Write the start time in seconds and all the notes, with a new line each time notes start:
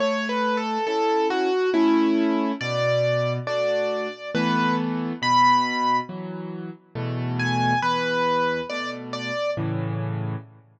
0.00 A3 C#5
0.29 B4
0.57 A4
0.87 C#4 E4 A4
1.30 F#4
1.74 A3 C#4 E4
2.61 B2 D5
3.47 A3 D4 F#4 D5
4.35 E3 A3 B3 B4
5.22 B2 B5
6.09 E3 F#3
6.95 E2 B2 A3
7.39 G#5
7.82 E2 B4
8.70 B2 A3 D5
9.13 D5
9.57 A2 C#3 E3